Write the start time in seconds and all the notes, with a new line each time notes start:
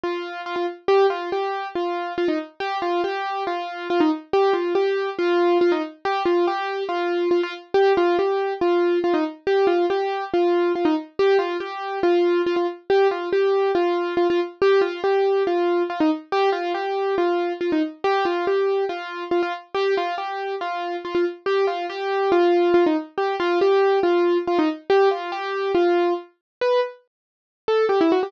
0.04 F4
0.46 F4
0.56 F4
0.88 G4
1.10 F4
1.32 G4
1.75 F4
2.18 F4
2.28 D#4
2.60 G4
2.82 F4
3.04 G4
3.47 F4
3.90 F4
4.00 D#4
4.33 G4
4.53 F4
4.75 G4
5.19 F4
5.61 F4
5.72 D#4
6.05 G4
6.26 F4
6.47 G4
6.89 F4
7.31 F4
7.43 F4
7.74 G4
7.97 F4
8.19 G4
8.61 F4
9.04 F4
9.14 D#4
9.47 G4
9.67 F4
9.90 G4
10.34 F4
10.75 F4
10.85 D#4
11.19 G4
11.39 F4
11.60 G4
12.03 F4
12.47 F4
12.56 F4
12.90 G4
13.11 F4
13.33 G4
13.75 F4
14.17 F4
14.30 F4
14.62 G4
14.81 F4
15.04 G4
15.47 F4
15.90 F4
16.00 D#4
16.32 G4
16.52 F4
16.74 G4
17.18 F4
17.61 F4
17.72 D#4
18.04 G4
18.25 F4
18.47 G4
18.89 F4
19.31 F4
19.43 F4
19.75 G4
19.97 F4
20.18 G4
20.61 F4
21.05 F4
21.15 F4
21.46 G4
21.67 F4
21.90 G4
22.32 F4
22.74 F4
22.86 D#4
23.18 G4
23.40 F4
23.61 G4
24.03 F4
24.47 F4
24.59 D#4
24.90 G4
25.11 F4
25.32 G4
25.75 F4
26.61 B4
27.68 A4
27.89 G4
28.01 E4
28.12 F#4
28.23 G4